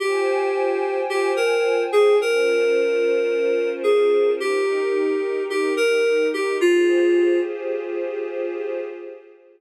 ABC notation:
X:1
M:4/4
L:1/8
Q:1/4=109
K:Fm
V:1 name="Electric Piano 2"
G4 G B2 A | B6 A2 | G4 G B2 G | F3 z5 |]
V:2 name="Pad 5 (bowed)"
[Fcga]8 | [DFBc]8 | [EGB]8 | [FGAc]8 |]